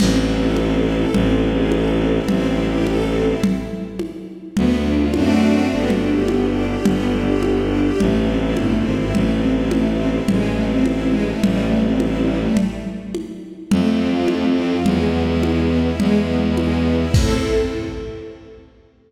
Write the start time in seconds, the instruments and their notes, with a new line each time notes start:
0.00 violin A1, string ensemble 1 C4, crash, low conga
0.19 string ensemble 1 E4
0.38 string ensemble 1 A4
0.56 string ensemble 1 C4, high conga
0.76 string ensemble 1 E4
0.95 string ensemble 1 A4
1.14 violin A1, string ensemble 1 C4, low conga
1.33 string ensemble 1 E4
1.52 string ensemble 1 G#4
1.71 string ensemble 1 A4, high conga
1.90 string ensemble 1 C4
2.10 string ensemble 1 E4
2.28 violin A1, string ensemble 1 C4, low conga
2.48 string ensemble 1 E4
2.67 string ensemble 1 G4
2.86 string ensemble 1 A4, high conga
3.05 string ensemble 1 C4
3.24 string ensemble 1 E4
3.43 low conga
3.99 high conga
4.57 violin D2, string ensemble 1 B3, low conga
4.76 string ensemble 1 D4
4.95 string ensemble 1 F4
5.14 violin F#2, string ensemble 1 A3 C4 D4 F#4, high conga
5.71 violin G1, string ensemble 1 B3
5.90 string ensemble 1 D4, low conga
6.10 string ensemble 1 G4
6.28 string ensemble 1 B3, high conga
6.48 string ensemble 1 D4
6.67 string ensemble 1 G4
6.85 violin G1, string ensemble 1 B3, low conga
7.05 string ensemble 1 D4
7.24 string ensemble 1 G4
7.43 string ensemble 1 B3, high conga
7.62 string ensemble 1 D4
7.81 string ensemble 1 G4
8.00 violin A1, string ensemble 1 A3, low conga
8.19 string ensemble 1 C4
8.38 string ensemble 1 E4
8.57 violin G1, string ensemble 1 A3, high conga
8.76 string ensemble 1 C4
8.86 violin G#1
8.95 string ensemble 1 E4
9.14 violin A1, string ensemble 1 A3, low conga
9.33 string ensemble 1 C4
9.52 string ensemble 1 E4
9.71 string ensemble 1 A3, high conga
9.90 string ensemble 1 C4
10.10 string ensemble 1 E4
10.28 violin A1, string ensemble 1 G#3, low conga
10.48 string ensemble 1 A3
10.67 string ensemble 1 C4
10.85 string ensemble 1 E4, high conga
11.05 string ensemble 1 G#3
11.24 string ensemble 1 A3
11.43 violin A1, string ensemble 1 G3, low conga
11.62 string ensemble 1 A3
11.81 string ensemble 1 C4
12.00 string ensemble 1 E4, high conga
12.19 string ensemble 1 G3
12.38 string ensemble 1 A3
12.57 low conga
13.15 high conga
13.71 violin F2, string ensemble 1 A3, low conga
13.91 string ensemble 1 C4
14.10 string ensemble 1 F4
14.28 string ensemble 1 A3, high conga
14.48 string ensemble 1 C4
14.67 string ensemble 1 F4
14.86 violin E2, string ensemble 1 G#3, low conga
15.05 string ensemble 1 B3
15.24 string ensemble 1 E4
15.43 string ensemble 1 G#3, high conga
15.62 string ensemble 1 B3
15.81 string ensemble 1 E4
16.00 violin E2, string ensemble 1 G#3, low conga
16.19 string ensemble 1 B3
16.38 string ensemble 1 E4
16.57 string ensemble 1 G#3, high conga
16.76 string ensemble 1 B3
16.95 string ensemble 1 E4
17.14 violin A2, string ensemble 1 C4 E4 A4, kick, crash